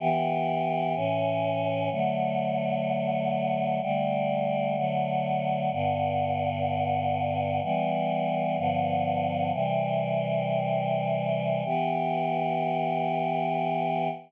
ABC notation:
X:1
M:4/4
L:1/8
Q:1/4=126
K:Em
V:1 name="Choir Aahs"
[E,B,G]4 [A,,E,^C]4 | [D,F,A,]8 | [D,G,A,]4 [D,F,A,]4 | [G,,D,B,]8 |
[E,G,B,]4 [G,,D,=F,B,]4 | "^rit." [C,E,G,]8 | [E,B,G]8 |]